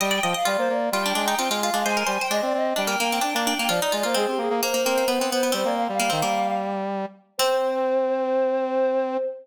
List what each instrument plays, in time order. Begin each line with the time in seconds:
0.00 brass section G3, pizzicato strings D#5, choir aahs G5
0.11 pizzicato strings D5
0.23 brass section F3, pizzicato strings D#5
0.34 pizzicato strings D#5, choir aahs F5
0.45 brass section G3, pizzicato strings F4, choir aahs D5
0.58 brass section A#3, choir aahs C5
0.69 brass section A#3, choir aahs D5
0.92 brass section G3, pizzicato strings F4, choir aahs G5
1.06 pizzicato strings D4
1.15 brass section G#3, pizzicato strings D4
1.28 pizzicato strings D#4
1.38 brass section C4, pizzicato strings F4
1.50 brass section G#3, pizzicato strings F4
1.62 pizzicato strings F4, choir aahs F5
1.73 brass section G#3, pizzicato strings D4
1.84 brass section G#3, pizzicato strings C5, choir aahs G#5
1.97 pizzicato strings A#4
2.07 brass section G3, pizzicato strings C5
2.20 pizzicato strings C5, choir aahs G5
2.30 brass section G#3, pizzicato strings D4, choir aahs D#5
2.42 brass section C4, choir aahs D5
2.54 brass section C4, choir aahs D#5
2.76 brass section G3, pizzicato strings D4, choir aahs G5
2.87 pizzicato strings A#3
3.00 pizzicato strings A#3, brass section A#3
3.12 pizzicato strings C4
3.21 pizzicato strings D4, brass section D4
3.34 brass section A#3, pizzicato strings D4
3.46 pizzicato strings D4, choir aahs G5
3.58 brass section A#3, pizzicato strings A#3
3.69 brass section F3, pizzicato strings F4, choir aahs D5
3.82 pizzicato strings D#4
3.92 brass section G#3, pizzicato strings F4
4.03 brass section A#3, pizzicato strings F4, choir aahs C5
4.14 brass section G#3, pizzicato strings C4, choir aahs G#4
4.27 brass section C4, choir aahs G4
4.38 brass section A#3, choir aahs G#4
4.50 brass section A#3
4.62 pizzicato strings A#3, choir aahs C5
4.74 pizzicato strings A#3
4.85 pizzicato strings A#3, brass section C4
4.98 pizzicato strings A#3
5.08 brass section B3, pizzicato strings B3
5.19 pizzicato strings B3, brass section C4
5.30 brass section B3, pizzicato strings B3, choir aahs C5
5.43 pizzicato strings B3
5.52 brass section G3, pizzicato strings C4, choir aahs C5
5.65 brass section A#3, choir aahs D5
5.77 choir aahs F5
5.89 brass section G3, choir aahs F5
6.00 brass section G3, pizzicato strings A#3
6.10 brass section D#3, pizzicato strings C4
6.22 brass section G3, pizzicato strings A#3
7.38 brass section C4, pizzicato strings C4, choir aahs C5